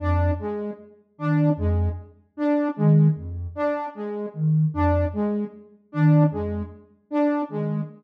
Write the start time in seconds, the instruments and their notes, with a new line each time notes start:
0.00 ocarina F2, lead 2 (sawtooth) D4
0.39 lead 2 (sawtooth) G#3
1.18 ocarina D#3, lead 2 (sawtooth) D4
1.57 ocarina F2, lead 2 (sawtooth) G#3
2.37 lead 2 (sawtooth) D4
2.76 ocarina D#3, lead 2 (sawtooth) G#3
3.15 ocarina F2
3.55 lead 2 (sawtooth) D4
3.95 lead 2 (sawtooth) G#3
4.34 ocarina D#3
4.74 ocarina F2, lead 2 (sawtooth) D4
5.13 lead 2 (sawtooth) G#3
5.92 ocarina D#3, lead 2 (sawtooth) D4
6.31 ocarina F2, lead 2 (sawtooth) G#3
7.11 lead 2 (sawtooth) D4
7.49 ocarina D#3, lead 2 (sawtooth) G#3